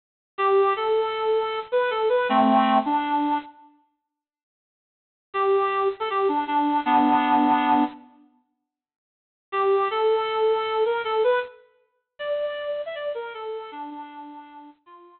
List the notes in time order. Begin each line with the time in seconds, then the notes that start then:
0.38 G4
0.76 A4
1.72 B4
1.90 A4
2.09 B4
2.29 A3 C4
2.85 D4
5.34 G4
6.00 A4
6.10 G4
6.28 D4
6.47 D4
6.85 B3 D4
9.52 G4
9.91 A4
10.85 A#4
11.04 A4
11.24 B4
12.19 D5
12.86 E5
12.95 D5
13.15 A#4
13.34 A4
13.72 D4
13.90 D4
14.86 F4